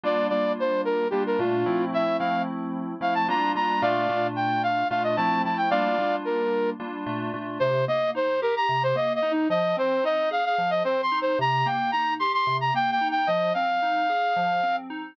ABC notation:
X:1
M:7/8
L:1/16
Q:1/4=111
K:Gm
V:1 name="Flute"
d2 d2 c2 B2 G B F4 | =e2 f2 z4 f a b2 b2 | [df]4 g2 f2 f e a2 a g | [df]4 B4 z6 |
[K:Cm] c2 e2 c2 B b2 c (3e2 e2 E2 | e2 c2 e2 f f2 e (3c2 c'2 c2 | b2 g2 b2 c' c'2 b (3g2 g2 g2 | e2 f10 z2 |]
V:2 name="Electric Piano 2"
[G,B,DF]2 [G,B,DF]6 [G,B,DF]2 [B,,A,DF]2 [F,A,C=E]2- | [F,A,C=E]2 [F,A,CE]6 [F,A,CE]2 [G,B,DF]2 [G,B,DF]2 | [B,,A,DF]2 [B,,A,DF]6 [B,,A,DF]2 [F,A,C=E]2 [F,A,CE]2 | [G,B,DF]2 [G,B,DF]6 [G,B,DF]2 [B,,A,DF]2 [B,,A,DF]2 |
[K:Cm] C,2 B,2 E2 G2 C,2 B,2 E2 | F,2 C2 E2 A2 F,2 C2 E2 | C,2 B,2 E2 G2 C,2 B,2 E2 | F,2 C2 E2 A2 F,2 C2 E2 |]